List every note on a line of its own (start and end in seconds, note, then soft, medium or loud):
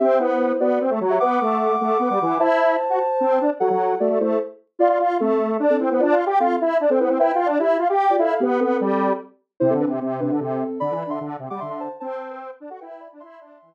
0.00 0.19 C4 medium
0.00 0.18 G4 medium
0.00 0.18 E5 medium
0.19 0.53 B3 medium
0.19 0.57 E4 medium
0.19 0.57 C5 medium
0.60 0.79 B3 medium
0.60 0.80 F#4 medium
0.60 0.80 D5 medium
0.81 0.91 C4 medium
0.90 1.00 A3 medium
1.01 1.19 F#3 medium
1.10 1.19 G4 medium
1.10 1.19 E5 medium
1.20 1.40 B3 medium
1.20 2.35 F#5 medium
1.20 2.35 D6 medium
1.41 1.76 A3 medium
1.81 1.98 A3 medium
1.99 2.09 B3 medium
2.10 2.19 G3 medium
2.21 2.38 E3 medium
2.40 2.77 E4 medium
2.40 3.43 C5 medium
2.40 3.43 A5 medium
2.90 2.99 F#4 medium
3.20 3.39 C4 medium
3.41 3.50 D4 medium
3.60 3.69 F#3 medium
3.60 3.93 A4 medium
3.60 3.93 F#5 medium
3.70 3.95 F#3 medium
4.00 4.09 A3 medium
4.00 4.19 F#4 medium
4.00 4.19 D5 medium
4.09 4.19 A3 medium
4.20 4.39 A3 medium
4.20 4.37 E4 medium
4.20 4.37 C5 medium
4.79 4.88 F4 medium
4.79 4.99 F4 loud
4.79 4.99 D5 loud
4.89 4.98 F4 medium
4.99 5.18 F4 medium
5.20 5.57 A3 medium
5.20 5.38 C4 medium
5.20 5.38 A4 medium
5.60 5.77 D4 medium
5.70 5.79 C4 medium
5.70 5.79 A4 loud
5.80 5.90 C4 medium
5.80 5.90 E4 medium
5.80 5.90 C5 medium
5.90 6.01 B3 medium
5.90 6.00 E4 medium
5.90 6.00 C5 medium
6.00 6.15 D4 medium
6.00 6.18 F4 medium
6.00 6.18 D5 loud
6.12 6.25 F4 medium
6.26 6.39 G4 medium
6.40 6.57 C4 medium
6.40 6.56 F4 medium
6.40 6.57 A4 medium
6.61 6.78 E4 medium
6.80 6.90 D4 medium
6.90 6.99 C4 medium
6.90 6.99 A4 loud
7.00 7.09 B3 medium
7.00 7.10 E4 medium
7.00 7.10 C5 medium
7.09 7.19 C4 medium
7.09 7.20 E4 medium
7.09 7.20 C5 medium
7.19 7.32 E4 medium
7.19 7.39 B4 loud
7.19 7.39 G5 loud
7.35 7.48 F4 medium
7.46 7.58 D4 medium
7.59 7.78 E4 medium
7.59 7.76 G4 medium
7.59 7.76 E5 medium
7.79 7.88 F4 medium
7.90 8.16 G4 medium
8.10 8.20 F4 medium
8.10 8.20 D5 medium
8.18 8.34 E4 medium
8.18 8.29 A4 medium
8.18 8.29 F5 medium
8.30 8.40 A4 medium
8.30 8.40 F5 medium
8.40 8.58 B3 medium
8.40 8.60 B3 medium
8.40 8.58 G4 loud
8.60 8.77 B3 medium
8.60 9.11 C4 medium
8.60 9.11 A4 medium
8.80 9.13 G3 medium
9.60 9.74 C3 medium
9.60 9.70 E4 medium
9.60 9.70 C5 loud
9.70 9.85 D3 medium
9.70 9.79 C4 medium
9.70 9.79 A4 medium
9.80 9.90 D4 medium
9.80 9.90 B4 medium
9.87 10.00 C3 medium
10.01 10.21 C3 medium
10.20 10.31 C3 medium
10.20 10.37 D4 medium
10.20 10.37 B4 medium
10.31 10.40 D3 medium
10.40 10.64 C3 medium
10.40 10.79 C4 medium
10.40 10.79 A4 medium
10.80 10.94 D3 medium
10.80 10.99 D5 medium
10.80 10.99 B5 loud
10.91 11.04 E3 medium
11.00 11.10 D5 medium
11.00 11.10 B5 medium
11.07 11.19 D3 medium
11.07 11.20 E5 medium
11.07 11.20 C6 medium
11.21 11.37 D3 medium
11.39 11.49 C3 medium
11.50 11.60 G3 medium
11.50 11.60 F#5 medium
11.50 11.60 D6 medium
11.60 11.89 D3 medium
11.60 11.70 E5 medium
11.60 11.70 C6 medium
11.70 11.79 E5 medium
11.70 11.79 C6 medium
11.80 11.90 C5 medium
11.80 11.90 A5 medium
12.00 12.51 C4 medium
12.00 12.18 C5 medium
12.00 12.18 A5 medium
12.20 12.29 C5 medium
12.20 12.29 A5 medium
12.30 12.40 B4 medium
12.30 12.40 G5 medium
12.60 12.70 D4 medium
12.70 12.80 F#4 medium
12.70 12.80 A4 medium
12.70 12.80 F#5 medium
12.80 13.08 E4 medium
12.80 12.90 B4 medium
12.80 12.90 G5 medium
12.90 13.00 B4 medium
12.90 13.00 G5 medium
13.00 13.10 D5 medium
13.00 13.10 B5 medium
13.12 13.22 D4 medium
13.20 13.40 E4 medium
13.20 13.74 E5 loud
13.20 13.74 C6 loud
13.40 13.58 D4 medium
13.62 13.74 E3 medium